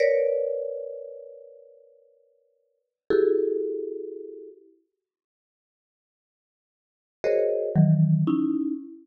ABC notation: X:1
M:9/8
L:1/8
Q:3/8=39
K:none
V:1 name="Marimba"
[_B=B_d=d]6 [E_G=G_A=A]3 | z5 [_G_A_Bc_d_e] [_E,=E,_G,] [_D_E=E] z |]